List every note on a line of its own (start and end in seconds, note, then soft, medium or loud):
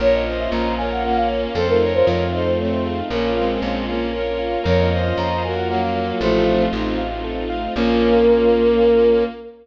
0.00 0.48 A#1 loud
0.00 1.53 A#3 loud
0.00 1.53 C#4 loud
0.00 1.53 F4 medium
0.00 0.23 A#4 medium
0.00 0.21 A#4 medium
0.00 0.12 C#5 medium
0.00 0.21 C#5 medium
0.13 0.36 D#5 medium
0.26 0.72 C5 medium
0.26 0.72 D#5 medium
0.26 0.50 F5 medium
0.39 0.51 E5 medium
0.51 1.47 A#1 loud
0.51 0.75 C#5 medium
0.51 0.74 A#5 medium
0.78 1.03 A#4 medium
0.78 1.03 C#5 medium
0.78 1.02 F5 medium
0.78 0.90 G#5 medium
0.91 1.03 F#5 medium
1.04 1.54 A#3 medium
1.04 1.54 C#4 medium
1.04 1.27 A#4 medium
1.04 1.16 F#5 medium
1.16 1.29 F5 medium
1.28 1.42 C#5 medium
1.28 1.52 F5 medium
1.55 2.03 F2 loud
1.55 3.09 A3 medium
1.55 3.09 C4 loud
1.55 3.09 D#4 medium
1.55 3.09 F4 medium
1.55 1.67 A4 medium
1.55 1.78 A4 medium
1.55 1.79 A4 medium
1.55 1.78 C5 medium
1.68 1.92 A#4 medium
1.81 2.23 A#4 medium
1.81 2.23 C#5 medium
1.81 2.04 F5 medium
1.94 2.06 C5 medium
2.06 3.02 F2 loud
2.06 2.30 D#5 medium
2.06 2.31 F5 medium
2.33 2.54 A4 medium
2.33 2.54 C5 medium
2.33 2.45 D#5 medium
2.33 2.56 F5 medium
2.45 2.58 C5 medium
2.57 3.00 A3 medium
2.57 3.00 C4 medium
2.57 2.80 A4 medium
2.57 2.71 C#5 medium
2.71 2.84 C5 medium
2.85 2.97 G#4 medium
2.85 3.09 F5 medium
3.09 3.58 A#1 loud
3.09 3.30 A#3 medium
3.09 4.64 A#3 medium
3.09 3.30 C#4 medium
3.09 4.64 C#4 loud
3.09 4.64 F4 loud
3.09 3.34 A#4 medium
3.09 3.59 A#4 medium
3.36 3.86 G#3 medium
3.36 3.86 C4 medium
3.36 3.59 F5 medium
3.62 4.57 A#1 loud
3.62 3.85 C#5 medium
3.87 4.11 A#3 medium
3.87 4.11 C#4 medium
3.87 4.12 F5 medium
4.13 4.36 A#4 medium
4.13 4.59 A#4 medium
4.13 4.59 C#5 medium
4.39 4.62 F5 medium
4.64 5.13 F2 loud
4.64 6.19 A#3 medium
4.64 6.19 C#4 loud
4.64 6.19 F4 medium
4.64 4.87 A#4 medium
4.64 4.89 A#4 medium
4.64 4.89 C#5 medium
4.64 4.78 C#5 medium
4.79 5.02 D#5 medium
4.90 5.42 C5 medium
4.90 5.42 D#5 medium
4.90 5.13 F5 medium
5.04 5.16 F5 medium
5.17 6.12 F2 loud
5.17 5.41 C#5 medium
5.17 5.42 A#5 medium
5.42 5.68 F#4 medium
5.42 5.68 A#4 medium
5.42 5.66 F5 medium
5.42 5.56 G#5 medium
5.56 5.68 F#5 medium
5.68 6.18 F#3 medium
5.68 6.18 A#3 medium
5.68 5.94 A#4 medium
5.68 5.81 F#5 medium
5.82 5.94 F5 medium
5.95 6.07 C#5 medium
5.95 6.19 F5 medium
6.20 6.68 A1 loud
6.20 6.65 F3 medium
6.20 6.65 A3 loud
6.20 7.74 A3 medium
6.20 7.74 C4 loud
6.20 7.74 D#4 loud
6.20 7.74 F4 loud
6.20 6.44 A4 medium
6.20 6.62 C5 medium
6.46 6.69 F5 medium
6.73 7.68 A1 loud
6.73 6.98 C4 medium
6.73 6.98 D#4 medium
6.73 6.96 D#5 medium
6.98 7.21 F5 medium
7.24 7.48 A4 medium
7.50 7.73 F5 medium
7.75 9.24 A#1 loud
7.75 9.23 A#3 loud
7.75 9.24 A#3 loud
7.75 9.25 A#3 loud
7.75 9.24 C#4 loud
7.75 9.25 C#4 loud
7.75 9.24 F4 loud
7.75 9.25 F4 loud
7.75 9.24 A#4 loud